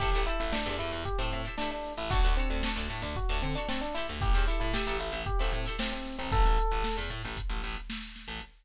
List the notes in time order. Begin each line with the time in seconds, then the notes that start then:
0.00 A1 E4 G4 A4 C5, kick, closed hi-hat
0.13 A1 E4 G4 A4 C5, closed hi-hat
0.26 E4 G4 A4 C5, closed hi-hat
0.39 A1 E4, closed hi-hat
0.52 D4 E4 G4 A4 C5, snare
0.66 E2 E4 G4 A4 C5, closed hi-hat
0.79 E2 E4, closed hi-hat
0.92 E2, closed hi-hat
1.05 G4, kick, closed hi-hat
1.18 A2 C4 E4 G4 A4 C5, closed hi-hat
1.31 A2, closed hi-hat
1.45 E4 G4 A4 C5, closed hi-hat
1.58 D4 E4 G4 A4 C5, snare
1.71 D4, closed hi-hat
1.84 snare, closed hi-hat
1.97 A1 E4, snare, closed hi-hat
2.10 D2 D4 F#4 A4 C#5, kick, closed hi-hat
2.23 D2 D4 F#4 A4 C#5, closed hi-hat
2.37 C4 D4 F#4 A4 C#5, closed hi-hat
2.50 D2, closed hi-hat
2.63 D4 F#4 A4 C#5, snare
2.76 D2 D4 F#4 A4 C#5, closed hi-hat
2.89 A2, closed hi-hat
3.02 D2 D4, snare, closed hi-hat
3.16 F#4, kick, closed hi-hat
3.29 D2 D4 F#4 A4 C#5, closed hi-hat
3.42 D3 C4, closed hi-hat
3.55 D4 F#4 A4 C#5, snare, closed hi-hat
3.68 C4 D4 F#4 A4 C#5, snare
3.81 D4, closed hi-hat
3.94 E4 G4 A4 C5, snare, closed hi-hat
4.08 D2, closed hi-hat
4.21 A1 G4, kick, closed hi-hat
4.34 E2 E4 G4 A4 C5, closed hi-hat
4.47 E4 G4 A4 C5, closed hi-hat
4.60 A2 E4, closed hi-hat
4.74 E4 G4 A4 C5, snare
4.87 A1 E4 G4 A4 C5, closed hi-hat
4.99 A1 E4, closed hi-hat
5.12 A1, closed hi-hat
5.26 G4, kick, closed hi-hat
5.39 A1 C4 E4 G4 A4 C5, snare, closed hi-hat
5.53 A2, closed hi-hat
5.66 E4 G4 A4 C5, closed hi-hat
5.79 C4 E4 G4 A4 C5, snare
5.92 C4, closed hi-hat
6.05 snare, closed hi-hat
6.19 A1 C4, closed hi-hat
6.31 A1 A4, kick, closed hi-hat
6.45 A1, snare, closed hi-hat
6.58 closed hi-hat
6.71 A1, closed hi-hat
6.84 snare
6.97 E2, closed hi-hat
7.10 A2, closed hi-hat
7.24 A1, closed hi-hat
7.37 kick, closed hi-hat
7.50 A1, closed hi-hat
7.63 A1, closed hi-hat
7.76 snare, closed hi-hat
7.90 snare
8.03 closed hi-hat
8.16 snare, closed hi-hat
8.28 A1, closed hi-hat